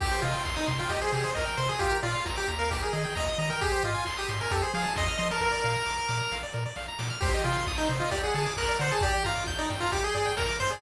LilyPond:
<<
  \new Staff \with { instrumentName = "Lead 1 (square)" } { \time 4/4 \key c \minor \tempo 4 = 133 g'8 f'8 r16 ees'16 r16 f'16 g'16 aes'16 aes'8 bes'8 c''16 aes'16 | g'8 f'8 r16 g'16 r16 bes'16 g'16 aes'16 aes'8 ees''8 ees''16 bes'16 | g'8 f'8 r16 g'16 r16 bes'16 g'16 aes'16 aes'8 ees''8 ees''16 bes'16 | bes'2~ bes'8 r4. |
g'8 f'8 r16 ees'16 r16 f'16 g'16 aes'16 aes'8 bes'8 c''16 aes'16 | g'8 f'8 r16 ees'16 r16 f'16 g'16 aes'16 aes'8 bes'8 c''16 aes'16 | }
  \new Staff \with { instrumentName = "Lead 1 (square)" } { \time 4/4 \key c \minor g'16 c''16 ees''16 g''16 c'''16 ees'''16 c'''16 g''16 ees''16 c''16 g'16 c''16 ees''16 g''16 c'''16 ees'''16 | f'16 bes'16 d''16 f''16 bes''16 d'''16 bes''16 f''16 g'16 bes'16 ees''16 g''16 bes''16 ees'''16 bes''16 g''16 | aes'16 c''16 ees''16 aes''16 c'''16 ees'''16 c'''16 aes''16 a'16 c''16 f''16 a''16 c'''16 f'''16 c'''16 a''16 | bes'16 d''16 f''16 bes''16 d'''16 f'''16 d'''16 bes''16 f''16 d''16 bes'16 d''16 f''16 bes''16 d'''16 f'''16 |
c''16 ees''16 g''16 c'''16 ees'''16 g'''16 c''16 ees''16 d''16 fis''16 a''16 d'''16 fis'''16 d''16 fis''16 a''16 | d''16 g''16 bes''16 d'''16 g'''16 d''16 g''16 bes''16 d'''16 g'''16 d''16 g''16 bes''16 d'''16 g'''16 d''16 | }
  \new Staff \with { instrumentName = "Synth Bass 1" } { \clef bass \time 4/4 \key c \minor c,8 c8 c,8 c8 c,8 c8 c,8 c8 | bes,,8 bes,8 bes,,8 ees,4 ees8 ees,8 ees8 | aes,,8 aes,8 aes,,8 aes,8 f,8 f8 f,8 f8 | bes,,8 bes,8 bes,,8 bes,8 bes,,8 bes,8 bes,,8 bes,8 |
c,8 c8 c,8 c8 d,8 d8 d,8 d8 | g,,8 g,8 g,,8 g,8 g,,8 g,8 g,,8 g,8 | }
  \new DrumStaff \with { instrumentName = "Drums" } \drummode { \time 4/4 <cymc bd>8 hho8 <hc bd>8 <hho bd>8 <hh bd>8 hho8 <bd sn>8 hho8 | <hh bd>8 hho8 <bd sn>8 hho8 <hh bd>8 hho8 <bd sn>8 hho8 | <hh bd>8 hho8 <hc bd>8 hho8 <hh bd>8 hho8 <bd sn>8 hho8 | <bd sn>8 sn8 sn8 sn8 sn8 sn8 sn8 sn8 |
<cymc bd>8 hho8 <hc bd>8 hho8 <hh bd>8 hho8 <hc bd>8 hho8 | <hh bd>8 hho8 <bd sn>8 hho8 <hh bd>8 hho8 <bd sn>8 hho8 | }
>>